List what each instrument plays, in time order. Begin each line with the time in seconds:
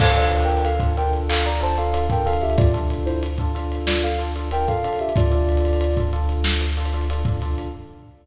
0.00 synth bass 2 D2, electric piano 1 D4 F4 A4, ocarina A4 F5, kick, crash
0.16 electric piano 1 D4 F4 A4, closed hi-hat
0.22 ocarina A4 F5
0.32 closed hi-hat
0.40 ocarina A#4 G5, closed hi-hat
0.48 closed hi-hat
0.57 closed hi-hat
0.64 ocarina A4 F5, closed hi-hat
0.80 electric piano 1 D4 F4 A4, kick, closed hi-hat
0.97 electric piano 1 D4 F4 A4, ocarina A#4 G5, closed hi-hat
1.13 closed hi-hat
1.29 ocarina A4 F5, clap
1.45 ocarina D5 A#5, closed hi-hat
1.60 electric piano 1 D4 F4 A4, ocarina C5 A5, closed hi-hat
1.77 electric piano 1 D4 F4 A4, ocarina A4 F5, closed hi-hat
1.93 electric piano 1 D4 F4 A4, closed hi-hat
2.09 electric piano 1 D4 F4 A4, ocarina A#4 G5, kick, closed hi-hat
2.25 electric piano 1 D4 F4 A4, ocarina A4 F5, closed hi-hat
2.33 closed hi-hat
2.41 ocarina G4 E5, closed hi-hat
2.50 closed hi-hat
2.57 ocarina F4 D5, kick, closed hi-hat
2.74 electric piano 1 D4 F4 A4, closed hi-hat
2.90 closed hi-hat
3.06 ocarina E4 C5, closed hi-hat
3.23 closed hi-hat
3.38 electric piano 1 D4 F4 A4, kick, closed hi-hat
3.55 electric piano 1 D4 F4 A4, closed hi-hat
3.72 closed hi-hat
3.87 ocarina F4 D5, snare
4.03 ocarina A4 F5, closed hi-hat
4.18 electric piano 1 D4 F4 A4, closed hi-hat
4.36 electric piano 1 D4 F4 A4, closed hi-hat
4.51 electric piano 1 D4 F4 A4, ocarina A#4 G5, closed hi-hat
4.68 electric piano 1 D4 F4 A4, ocarina A4 F5, kick, closed hi-hat
4.84 electric piano 1 D4 F4 A4, closed hi-hat
4.93 closed hi-hat
4.99 ocarina G4 E5, closed hi-hat
5.09 closed hi-hat
5.16 synth bass 2 D2, electric piano 1 D4 F4 A4, ocarina F4 D5, kick, closed hi-hat
5.32 electric piano 1 D4 F4 A4, closed hi-hat
5.49 closed hi-hat
5.57 closed hi-hat
5.65 closed hi-hat
5.73 closed hi-hat
5.81 closed hi-hat
5.97 electric piano 1 D4 F4 A4, kick, closed hi-hat
6.13 electric piano 1 D4 F4 A4, closed hi-hat
6.29 closed hi-hat
6.44 snare
6.61 closed hi-hat
6.77 electric piano 1 D4 F4 A4, closed hi-hat
6.85 closed hi-hat
6.93 electric piano 1 D4 F4 A4, closed hi-hat
7.01 closed hi-hat
7.10 electric piano 1 D4 F4 A4, closed hi-hat
7.25 electric piano 1 D4 F4 A4, kick, closed hi-hat
7.42 electric piano 1 D4 F4 A4, closed hi-hat
7.58 closed hi-hat